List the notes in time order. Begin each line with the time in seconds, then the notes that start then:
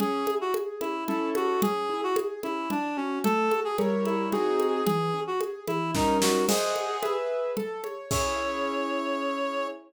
0.00 C#4 G#4, low conga
0.27 E4, high conga
0.41 F#4
0.54 G#4, high conga
0.81 C#4 E4, high conga
1.08 C#4 E4 A4, low conga
1.35 F#4, high conga
1.62 C#4 G#4, low conga
1.89 E4
2.03 F#4
2.16 G#4, high conga
2.43 C#4 E4, high conga
2.70 D4, low conga
2.97 C#4 F#4
3.24 A3 A4, low conga
3.51 F#4, high conga
3.64 G#4
3.78 G3 E4 A#4 C#5, high conga
4.05 E4, high conga
4.32 C4 D#4 F#4 G#4, low conga
4.60 high conga
4.85 E3 G#4, low conga
5.14 C#4
5.27 F#4
5.40 G#4, high conga
5.67 E3 E4, high conga
5.95 G3 C#4 D#4 A#4, kick, snare
6.22 F#4, snare
6.48 G#4 C5 D#5 F#5, crash, low conga
6.76 high conga
7.03 G#4 B4 E5, high conga
7.57 A4, low conga
7.84 C#5, high conga
8.11 C#4 E4 G#4 C#5, kick, crash